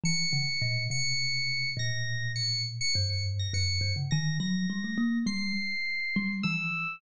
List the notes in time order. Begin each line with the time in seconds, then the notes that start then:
0.04 E3 C#7
0.33 C#3
0.62 A#2
0.90 C3 C#7
1.77 A#2 A#6
2.36 C#7
2.81 C#7
2.94 G2 C#7
3.10 C#7
3.39 A#6
3.54 F#2 C#7
3.81 G2
3.96 C#3
4.11 D#3 A#6
4.40 F#3 A#6
4.70 G3
4.84 A3
4.98 A#3
5.26 G3 C7
6.16 G3
6.43 E3 E6